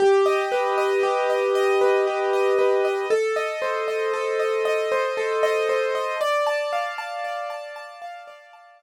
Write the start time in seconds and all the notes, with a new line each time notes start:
0.00 G4
0.26 D#5
0.52 B4
0.78 D#5
1.03 G4
1.30 D#5
1.55 D#5
1.81 B4
2.07 G4
2.33 D#5
2.59 B4
2.85 D#5
3.10 A4
3.36 D#5
3.62 C5
3.88 D#5
4.13 A4
4.40 D#5
4.65 D#5
4.92 C5
5.17 A4
5.43 D#5
5.69 C5
5.95 D#5
6.21 D5
6.47 A5
6.73 F5
6.98 A5
7.24 D5
7.50 A5
7.76 A5
8.02 F5
8.27 D5
8.53 A5
8.79 F5